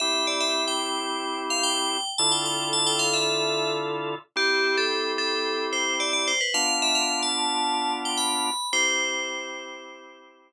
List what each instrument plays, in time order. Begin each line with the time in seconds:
0.00 drawbar organ C4 E4 G4, tubular bells E5
0.27 tubular bells D5
0.40 tubular bells E5
0.68 tubular bells G5
1.50 tubular bells F5
1.63 tubular bells G5
2.18 drawbar organ D3 E4 F4 A4, tubular bells A5
2.32 tubular bells G5
2.45 tubular bells G5
2.73 tubular bells A5
2.87 tubular bells G5
2.99 tubular bells F5
3.14 tubular bells E5
4.36 drawbar organ C4 E4 G4, tubular bells G4
4.78 tubular bells A4
5.18 tubular bells A4
5.73 tubular bells C5
6.00 tubular bells D5
6.13 tubular bells D5
6.28 tubular bells C5
6.41 tubular bells B4
6.54 drawbar organ B3 D4 F4, tubular bells F5
6.82 tubular bells E5
6.95 tubular bells F5
7.23 tubular bells A5
8.05 tubular bells G5
8.18 tubular bells B5
8.73 drawbar organ C4 E4 G4, tubular bells C5